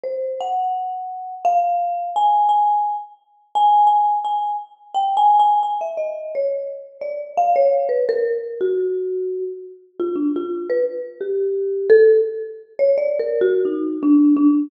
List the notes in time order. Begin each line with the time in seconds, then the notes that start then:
0.03 C5
0.40 F#5
1.45 F5
2.16 G#5
2.49 G#5
3.55 G#5
3.87 G#5
4.24 G#5
4.94 G5
5.17 G#5
5.39 G#5
5.63 G#5
5.81 E5
5.97 D#5
6.35 C#5
7.01 D5
7.37 F5
7.56 C#5
7.89 B4
8.09 A#4
8.61 F#4
9.99 F4
10.15 D4
10.36 F4
10.69 B4
11.21 G4
11.90 A4
12.79 C#5
12.98 D5
13.19 A#4
13.41 F#4
13.65 D#4
14.03 D4
14.36 D4